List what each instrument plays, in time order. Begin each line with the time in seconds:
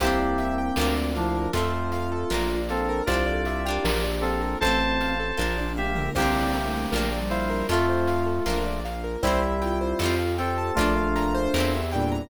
0.00 synth bass 1 C2, electric piano 2 A#3 G4, pad 2 (warm) C4 D4 E4 G4, ocarina C4, orchestral harp E4 G4, acoustic grand piano C5, kick, closed hi-hat
0.05 orchestral harp C4 D4
0.19 acoustic grand piano D5
0.38 acoustic grand piano E5, closed hi-hat
0.58 acoustic grand piano G5
0.76 synth bass 1 D2, pad 2 (warm) A#3 D4 F4, orchestral harp D4 F4, acoustic grand piano A#4, snare
0.81 orchestral harp A#3
0.96 acoustic grand piano D5
1.15 electric piano 2 F3 D4, ocarina E4, acoustic grand piano F5, closed hi-hat
1.35 acoustic grand piano A#4
1.53 synth bass 1 F2, pad 2 (warm) A3 C4 F4, electric piano 2 A3 F4, orchestral harp C4 F4, ocarina F4, acoustic grand piano A4, kick, closed hi-hat
1.57 orchestral harp A3
1.73 acoustic grand piano C5
1.92 acoustic grand piano F5, closed hi-hat
2.12 acoustic grand piano A4
2.30 synth bass 1 A#1, pad 2 (warm) A#3 D4 F4, orchestral harp A#3 D4 F4, acoustic grand piano A#4, snare
2.50 acoustic grand piano D5
2.69 electric piano 2 C4 A4, ocarina A4, acoustic grand piano F5, closed hi-hat
2.89 acoustic grand piano A#4
3.06 synth bass 1 C2, pad 2 (warm) C4 D4 E4 G4, orchestral harp E4 G4, electric piano 2 F4 D5, acoustic grand piano C5, kick, closed hi-hat
3.12 orchestral harp C4 D4
3.26 ocarina A4, acoustic grand piano D5
3.45 acoustic grand piano E5, closed hi-hat
3.66 orchestral harp D4 F4, ocarina G4, acoustic grand piano G5
3.70 orchestral harp A#3
3.84 synth bass 1 A#1, pad 2 (warm) A#3 D4 F4, acoustic grand piano A#4, snare
4.04 acoustic grand piano D5
4.21 electric piano 2 C4 A4, acoustic grand piano F5, closed hi-hat
4.41 ocarina A4, acoustic grand piano A#4
4.60 synth bass 1 A1, pad 2 (warm) A3 C4 F4, ocarina C4, orchestral harp F4, acoustic grand piano A4, electric piano 2 C5 A5, kick, closed hi-hat
4.65 orchestral harp A3 C4
4.80 acoustic grand piano C5
5.00 acoustic grand piano F5, closed hi-hat
5.20 acoustic grand piano A4
5.37 synth bass 1 A#1, pad 2 (warm) A#3 D4 F4, orchestral harp A#3 D4 F4, acoustic grand piano A#4, kick, snare
5.57 acoustic grand piano D5, high tom
5.76 electric piano 2 G4 E5, acoustic grand piano F5, mid tom
5.95 acoustic grand piano A#4, floor tom
6.15 synth bass 1 C2, electric piano 2 A#3 G4, pad 2 (warm) C4 D4 E4 G4, ocarina C4, orchestral harp E4 G4, acoustic grand piano C5, kick, crash
6.20 orchestral harp C4 D4
6.35 acoustic grand piano D5
6.53 acoustic grand piano E5, closed hi-hat
6.66 ocarina A3
6.73 acoustic grand piano G5
6.92 synth bass 1 A#1, pad 2 (warm) A#3 D4 F4, orchestral harp D4 F4, acoustic grand piano A#4, snare
6.98 orchestral harp A#3
7.12 acoustic grand piano D5
7.18 ocarina G3
7.29 electric piano 2 E4 C5, acoustic grand piano F5, closed hi-hat
7.50 acoustic grand piano A#4
7.69 synth bass 1 F2, pad 2 (warm) A3 C4 F4, electric piano 2 A3 F4, orchestral harp C4 F4, ocarina F4, acoustic grand piano A4, closed hi-hat
7.73 orchestral harp A3
7.89 acoustic grand piano C5
8.08 acoustic grand piano F5, closed hi-hat
8.26 acoustic grand piano A4
8.46 synth bass 1 A#1, pad 2 (warm) A#3 D4 F4, orchestral harp A#3 D4 F4, acoustic grand piano A#4, snare
8.66 acoustic grand piano D5
8.85 acoustic grand piano F5, closed hi-hat
9.04 acoustic grand piano A#4
9.22 synth bass 1 C2, electric piano 2 G3 E4, pad 2 (warm) C4 E4 G4, ocarina E4, orchestral harp E4 G4, acoustic grand piano C5, kick, closed hi-hat
9.27 orchestral harp C4
9.42 acoustic grand piano E5
9.62 ocarina F4, acoustic grand piano G5, closed hi-hat
9.81 acoustic grand piano C5
9.99 synth bass 1 F2, pad 2 (warm) C4 F4 G4 A4, orchestral harp G4 A4, acoustic grand piano C5, snare
10.04 orchestral harp C4 F4
10.19 acoustic grand piano F5
10.38 electric piano 2 C4 A4, ocarina F4, acoustic grand piano G5, closed hi-hat
10.58 acoustic grand piano A5
10.75 synth bass 1 A#1, electric piano 2 A3 F4, pad 2 (warm) D4 F4 A#4, ocarina D4, orchestral harp A#4, acoustic grand piano D5, kick, closed hi-hat
10.79 orchestral harp D4 F4
10.96 acoustic grand piano F5
11.16 acoustic grand piano A#5, closed hi-hat
11.35 acoustic grand piano C5
11.54 synth bass 1 E2, pad 2 (warm) C4 E4 G4 A#4, orchestral harp G4 A#4, snare
11.58 orchestral harp C4 E4
11.73 acoustic grand piano E5
11.91 electric piano 2 A#2 G3, ocarina D4, acoustic grand piano G5, closed hi-hat
12.12 acoustic grand piano A#5